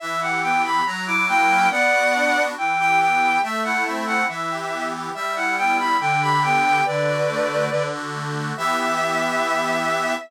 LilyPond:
<<
  \new Staff \with { instrumentName = "Violin" } { \time 2/2 \key e \minor \tempo 2 = 70 e''8 fis''8 g''8 b''8 ais''8 d'''8 g''4 | <d'' fis''>2 g''8 g''8 g''4 | e''8 fis''8 e''8 fis''8 e''4. r8 | e''8 fis''8 g''8 b''8 g''8 b''8 g''4 |
<b' d''>2~ <b' d''>8 r4. | e''1 | }
  \new Staff \with { instrumentName = "Accordion" } { \time 2/2 \key e \minor e8 g'8 b8 g'8 fis8 e'8 ais8 cis'8 | b8 fis'8 d'8 fis'8 e8 g'8 b8 g'8 | a8 e'8 c'8 e'8 e8 g'8 b8 g'8 | g8 e'8 b8 e'8 d8 g'8 b8 g'8 |
d8 fis'8 a8 fis'8 d8 fis'8 a8 fis'8 | <e b g'>1 | }
>>